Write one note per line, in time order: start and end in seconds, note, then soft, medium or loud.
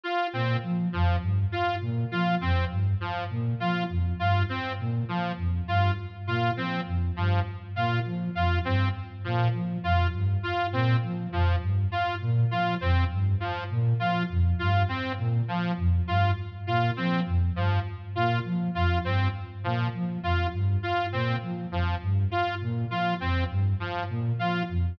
0.03 0.27 F4 medium
0.33 0.57 A#2 medium
0.33 0.57 C4 medium
0.63 0.87 F3 medium
0.93 1.17 F2 medium
0.93 1.16 F3 medium
1.21 1.45 G2 medium
1.52 1.76 F4 medium
1.81 2.05 A#2 medium
2.11 2.35 F3 medium
2.11 2.35 F4 medium
2.41 2.65 F2 medium
2.41 2.65 C4 medium
2.71 2.94 G2 medium
3.00 3.24 F3 medium
3.30 3.54 A#2 medium
3.60 3.84 F3 medium
3.60 3.84 F4 medium
3.89 4.13 F2 medium
4.19 4.43 G2 medium
4.19 4.43 F4 medium
4.49 4.73 C4 medium
4.79 5.03 A#2 medium
5.08 5.32 F3 medium
5.37 5.61 F2 medium
5.67 5.91 G2 medium
5.67 5.92 F4 medium
6.27 6.51 A#2 medium
6.27 6.51 F4 medium
6.57 6.81 F3 medium
6.57 6.81 C4 medium
6.87 7.10 F2 medium
7.16 7.40 G2 medium
7.16 7.40 F3 medium
7.76 8.00 A#2 medium
7.76 8.00 F4 medium
8.06 8.29 F3 medium
8.35 8.59 F2 medium
8.35 8.59 F4 medium
8.65 8.89 G2 medium
8.65 8.89 C4 medium
9.24 9.49 A#2 medium
9.24 9.48 F3 medium
9.54 9.77 F3 medium
9.83 10.07 F2 medium
9.83 10.07 F4 medium
10.13 10.37 G2 medium
10.43 10.67 F4 medium
10.72 10.96 A#2 medium
10.72 10.97 C4 medium
11.03 11.27 F3 medium
11.32 11.56 F2 medium
11.32 11.56 F3 medium
11.61 11.85 G2 medium
11.92 12.15 F4 medium
12.21 12.45 A#2 medium
12.51 12.75 F3 medium
12.51 12.75 F4 medium
12.81 13.04 F2 medium
12.81 13.04 C4 medium
13.11 13.35 G2 medium
13.40 13.64 F3 medium
13.70 13.94 A#2 medium
14.00 14.24 F3 medium
14.00 14.23 F4 medium
14.30 14.53 F2 medium
14.59 14.83 G2 medium
14.59 14.83 F4 medium
14.89 15.12 C4 medium
15.18 15.42 A#2 medium
15.48 15.72 F3 medium
15.77 16.01 F2 medium
16.07 16.31 G2 medium
16.07 16.31 F4 medium
16.67 16.91 A#2 medium
16.67 16.91 F4 medium
16.97 17.21 F3 medium
16.97 17.20 C4 medium
17.26 17.50 F2 medium
17.55 17.79 G2 medium
17.55 17.80 F3 medium
18.15 18.39 A#2 medium
18.15 18.39 F4 medium
18.45 18.68 F3 medium
18.75 18.99 F2 medium
18.75 18.99 F4 medium
19.04 19.28 G2 medium
19.04 19.28 C4 medium
19.64 19.87 A#2 medium
19.64 19.88 F3 medium
19.94 20.18 F3 medium
20.23 20.47 F2 medium
20.23 20.47 F4 medium
20.53 20.77 G2 medium
20.83 21.06 F4 medium
21.12 21.36 A#2 medium
21.12 21.36 C4 medium
21.43 21.66 F3 medium
21.71 21.95 F2 medium
21.71 21.96 F3 medium
22.01 22.25 G2 medium
22.31 22.55 F4 medium
22.61 22.85 A#2 medium
22.91 23.14 F3 medium
22.91 23.14 F4 medium
23.20 23.44 F2 medium
23.20 23.44 C4 medium
23.50 23.73 G2 medium
23.80 24.03 F3 medium
24.09 24.33 A#2 medium
24.39 24.63 F3 medium
24.39 24.63 F4 medium
24.69 24.93 F2 medium